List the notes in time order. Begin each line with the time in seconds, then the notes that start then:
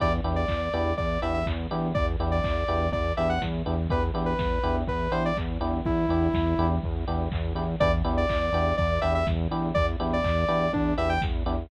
0.00 E2 B3 D4 E4 G4 D5, kick, crash
0.24 E2 B3 D4 E4 G4, open hi-hat
0.36 D5
0.48 E2, kick, clap
0.73 E2 B3 D4 E4 G4, open hi-hat
0.97 E2 D5, kick, closed hi-hat
1.22 E2 B3 D4 E4 G4 E5, open hi-hat
1.34 E5
1.46 E2, kick, clap
1.71 E2 B3 D4 E4 G4, open hi-hat
1.95 E2 D5, kick, closed hi-hat
2.20 E2 B3 D4 E4 G4, open hi-hat
2.32 D5
2.44 E2, kick, clap
2.68 E2 B3 D4 E4 G4, open hi-hat
2.92 E2 D5, kick, closed hi-hat
3.17 E2 B3 D4 E4 G4 E5, open hi-hat
3.29 F#5
3.42 E2, kick, snare
3.66 E2 B3 D4 E4 G4, open hi-hat
3.90 E2 B3 D4 E4 G4 B4, kick, closed hi-hat
4.14 E2 B3 D4 E4 G4, open hi-hat
4.26 B4
4.38 E2, kick, snare
4.63 E2 B3 D4 E4 G4, open hi-hat
4.87 E2 B4, kick, closed hi-hat
5.12 E2 B3 D4 E4 G4 C5, open hi-hat
5.25 D5
5.37 E2, kick, clap
5.60 E2 B3 D4 E4 G4, open hi-hat
5.85 E2 E4, kick, closed hi-hat
6.08 E2 B3 D4 E4 G4, open hi-hat
6.34 E2, kick, snare
6.58 E2 B3 D4 E4 G4, open hi-hat
6.83 E2, kick, closed hi-hat
7.07 E2 B3 D4 E4 G4, open hi-hat
7.32 E2, kick, clap
7.55 E2 B3 D4 E4 G4, open hi-hat
7.80 E2 B3 D4 E4 G4 D5, kick, closed hi-hat
8.04 E2 B3 D4 E4 G4, open hi-hat
8.17 D5
8.29 E2, kick, clap
8.53 E2 B3 D4 E4 G4, open hi-hat
8.77 E2 D5, kick, closed hi-hat
9.01 E2 B3 D4 E4 G4 E5, open hi-hat
9.15 E5
9.27 E2, kick, snare
9.51 E2 B3 D4 E4 G4, open hi-hat
9.74 E2 D5, kick, closed hi-hat
10.00 E2 B3 D4 E4 G4, open hi-hat
10.13 D5
10.24 E2, kick, clap
10.48 E2 B3 D4 E4 G4, open hi-hat
10.73 E2 D4, kick, closed hi-hat
10.98 E2 B3 D4 E4 G4 E5, open hi-hat
11.09 G5
11.22 E2, kick, snare
11.46 E2 B3 D4 E4 G4, open hi-hat